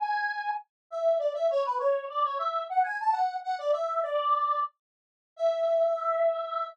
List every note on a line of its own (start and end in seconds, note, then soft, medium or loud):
0.00 0.51 G#5 loud
0.90 1.18 E5 medium
1.19 1.33 D5 medium
1.34 1.47 E5 medium
1.50 1.63 C#5 loud
1.65 1.78 B4 loud
1.79 2.05 C#5 loud
2.09 2.23 D5 medium
2.24 2.38 C#5 loud
2.39 2.64 E5 loud
2.70 2.83 F#5 loud
2.84 2.98 G#5 medium
3.00 3.15 A5 loud
3.12 3.37 F#5 medium
3.43 3.55 F#5 loud
3.58 3.72 D5 loud
3.72 4.01 E5 loud
4.03 4.60 D5 loud
5.36 6.66 E5 loud